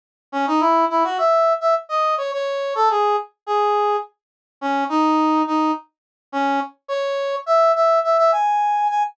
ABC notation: X:1
M:4/4
L:1/16
Q:1/4=105
K:C#m
V:1 name="Brass Section"
z2 C D E2 E F e3 e z d2 c | c3 A G2 z2 G4 z4 | C2 D4 D2 z4 C2 z2 | c4 e2 e2 e e g4 g z |]